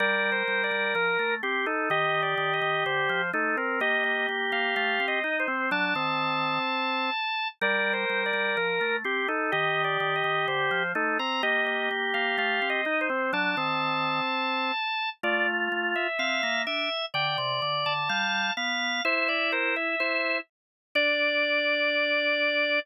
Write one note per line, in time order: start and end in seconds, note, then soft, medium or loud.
0.00 0.43 G3 loud
0.00 1.35 A#4 loud
0.00 0.30 D5 medium
0.32 0.62 C5 medium
0.48 0.70 G3 medium
0.64 0.94 D5 medium
0.71 0.94 G3 medium
0.95 1.17 F3 medium
0.95 1.35 A#4 medium
1.19 1.42 A3 medium
1.43 1.66 C4 medium
1.43 1.65 G4 medium
1.43 1.66 G4 medium
1.66 1.89 D#4 medium
1.66 1.89 A4 medium
1.90 2.35 D#3 medium
1.90 3.22 G4 loud
1.90 2.21 D#5 medium
2.22 2.53 D5 medium
2.38 2.60 D#3 medium
2.53 2.84 D#5 medium
2.62 2.84 D#3 medium
2.86 3.09 D3 medium
2.86 3.30 C5 medium
3.09 3.32 F3 medium
3.33 3.56 A3 medium
3.33 3.56 D#4 medium
3.33 3.57 A4 medium
3.57 3.80 C4 medium
3.57 3.80 A#4 medium
3.80 4.27 A#3 medium
3.80 5.20 G4 medium
3.80 4.03 D#5 medium
4.04 4.27 D#5 medium
4.29 4.51 A#3 medium
4.52 4.75 A#3 medium
4.52 4.75 F5 medium
4.76 4.99 A3 medium
4.76 5.06 F5 medium
5.00 5.22 C4 medium
5.08 5.38 D#5 medium
5.24 5.46 D#4 medium
5.24 5.46 D#4 loud
5.40 5.70 C5 medium
5.48 5.70 C4 medium
5.71 5.94 F#3 loud
5.71 5.94 D4 medium
5.71 7.48 A5 medium
5.95 6.59 D#3 medium
5.95 7.10 C4 medium
7.61 8.05 G3 loud
7.61 8.96 A#4 loud
7.61 7.93 D5 medium
7.93 8.23 C5 medium
8.10 8.32 G3 medium
8.26 8.56 D5 medium
8.33 8.56 G3 medium
8.57 8.80 F3 medium
8.57 8.97 A#4 medium
8.81 9.04 A3 medium
9.04 9.27 C4 medium
9.04 9.28 G4 medium
9.28 9.51 D#4 medium
9.28 9.51 A4 medium
9.52 9.97 D#3 medium
9.52 10.83 G4 loud
9.52 9.83 D#5 medium
9.84 10.14 D5 medium
10.00 10.23 D#3 medium
10.16 10.46 D#5 medium
10.24 10.47 D#3 medium
10.48 10.70 D3 medium
10.48 10.92 C5 medium
10.71 10.94 F3 medium
10.95 11.18 A3 medium
10.95 11.18 D#4 medium
10.95 11.18 A4 medium
11.19 11.42 C4 medium
11.19 11.42 A#5 medium
11.43 11.89 A#3 medium
11.43 12.81 G4 medium
11.43 11.66 D#5 medium
11.66 11.89 D#5 medium
11.91 12.13 A#3 medium
12.14 12.37 A#3 medium
12.14 12.37 F5 medium
12.38 12.60 A3 medium
12.38 12.69 F5 medium
12.62 12.85 C4 medium
12.70 13.00 D#5 medium
12.85 13.08 D#4 medium
12.85 13.09 D#4 loud
13.01 13.31 C5 medium
13.10 13.32 C4 medium
13.33 13.55 F#3 loud
13.33 13.56 D4 medium
13.33 15.10 A5 medium
13.57 14.21 D#3 medium
13.57 14.72 C4 medium
15.23 15.69 A3 loud
15.23 16.07 F4 loud
15.23 15.46 D5 medium
15.72 15.94 A3 medium
15.95 16.63 E5 medium
16.19 16.41 C4 medium
16.19 16.62 F5 medium
16.43 16.66 A#3 medium
16.67 16.89 D4 medium
16.67 17.06 E5 medium
17.14 17.37 D3 medium
17.14 17.93 D5 medium
17.14 17.37 G5 medium
17.38 17.61 C3 medium
17.62 17.85 D3 medium
17.86 18.09 D3 medium
17.86 18.53 A5 medium
18.09 18.51 G3 medium
18.09 18.52 F5 medium
18.57 19.01 B3 medium
18.57 19.03 F5 medium
19.05 19.95 E4 loud
19.05 19.28 C5 loud
19.05 19.27 E5 medium
19.28 19.51 D5 medium
19.28 19.51 E5 medium
19.52 19.75 A#4 medium
19.52 19.75 C5 medium
19.76 20.38 E5 medium
20.00 20.40 E4 medium
20.00 20.38 C5 medium
20.95 22.79 D4 loud
20.95 22.79 D5 loud
20.95 22.80 D5 loud